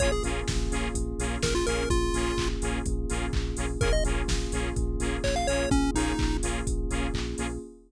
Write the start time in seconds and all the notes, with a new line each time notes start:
0.00 A#1 A#3 C#4 F4 G#4 C#5, kick, closed hi-hat
0.12 G#4
0.24 A#1 A#3 C#4 F4 G#4, open hi-hat
0.48 A#1, kick, snare
0.71 A#1 A#3 C#4 F4 G#4, open hi-hat
0.94 A#1, kick, closed hi-hat
1.19 A#1 A#3 C#4 F4 G#4, open hi-hat
1.42 A#1 A#4, kick, snare
1.55 F4
1.67 A#1 A#3 C#4 F4 G#4 A#4, open hi-hat
1.90 A#1 F4, kick, closed hi-hat
2.13 A#1 A#3 C#4 F4 G#4, open hi-hat
2.38 A#1, kick, clap
2.62 A#1 A#3 C#4 F4 G#4, open hi-hat
2.86 A#1, kick, closed hi-hat
3.09 A#1 A#3 C#4 F4 G#4, open hi-hat
3.33 A#1, kick, clap
3.57 A#1 A#3 C#4 F4 G#4, open hi-hat
3.81 A#1 A#3 C#4 F4 G#4 A#4, kick, closed hi-hat
3.93 D#5
4.04 A#1 A#3 C#4 F4 G#4, open hi-hat
4.28 A#1, kick, snare
4.52 A#1 A#3 C#4 F4 G#4, open hi-hat
4.76 A#1, kick, closed hi-hat
4.99 A#1 A#3 C#4 F4 G#4, open hi-hat
5.24 A#1 C#5, kick, clap
5.36 F5
5.47 A#1 A#3 C#4 F4 G#4 C#5, open hi-hat
5.71 A#1 C#4, kick, closed hi-hat
5.94 A#1 A#3 C#4 D#4 F4 G#4, open hi-hat
6.19 A#1, kick, clap
6.43 A#1 A#3 C#4 F4 G#4, open hi-hat
6.66 A#1, kick, closed hi-hat
6.90 A#1 A#3 C#4 F4 G#4, open hi-hat
7.14 A#1, kick, clap
7.38 A#1 A#3 C#4 F4 G#4, open hi-hat